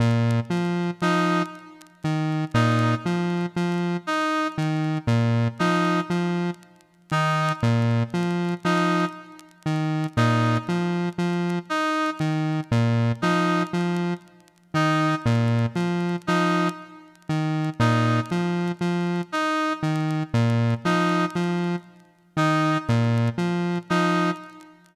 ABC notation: X:1
M:6/4
L:1/8
Q:1/4=59
K:none
V:1 name="Lead 1 (square)" clef=bass
_B,, F, F, z _E, B,, F, F, z E, B,, F, | F, z _E, _B,, F, F, z E, B,, F, F, z | _E, _B,, F, F, z E, B,, F, F, z E, B,, | F, F, z _E, _B,, F, F, z E, B,, F, F, |]
V:2 name="Brass Section"
z2 _E z2 E z2 E z2 E | z2 _E z2 E z2 E z2 E | z2 _E z2 E z2 E z2 E | z2 _E z2 E z2 E z2 E |]